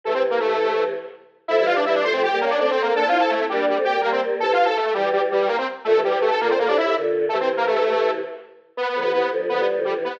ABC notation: X:1
M:4/4
L:1/16
Q:1/4=165
K:Aphr
V:1 name="Lead 1 (square)"
[A,A] [Cc] z [B,B] [A,A]6 z6 | [Ee] [Ee] [Ff] [Dd] [Ee] [Dd] [cc'] [Cc] [Gg]2 [B,B] [Dd] (3[Dd]2 [Cc]2 [B,B]2 | (3[Aa]2 [Ff]2 [Aa]2 [A,A]2 [G,G]2 [G,G] z [Gg]2 [B,B] [Cc] z2 | (3[Aa]2 [Ff]2 [Aa]2 [A,A]2 [G,G]2 [G,G] z [G,G]2 [B,B] [Cc] z2 |
[A,A]2 [G,G]2 [A,A] [Aa] [B,B] [Cc] [B,B] [Dd] [Ee]2 z4 | [A,A] [Cc] z [B,B] [A,A]6 z6 | [K:Ephr] (3[B,B]2 [B,B]2 [B,B]2 [B,B]2 z2 [B,B]2 z2 [G,G] z [B,B]2 |]
V:2 name="Choir Aahs"
[C,E,]10 z6 | [F,A,] [E,G,]5 [F,A,]3 [G,B,] _D2 [A,C]4 | [B,D] [CE]5 [B,D]3 [A,C] [G,B,]2 [G,B,]4 | [C,E,]3 z3 [E,G,]6 z4 |
[B,,D,] [C,E,]5 [B,,D,]3 [A,,C,] [A,,C,]2 [B,,D,]4 | [C,E,]10 z6 | [K:Ephr] z2 [D,F,] [C,E,] [C,E,]2 [D,F,]2 [D,F,] [E,G,]2 [D,F,]2 [C,E,]2 [E,G,] |]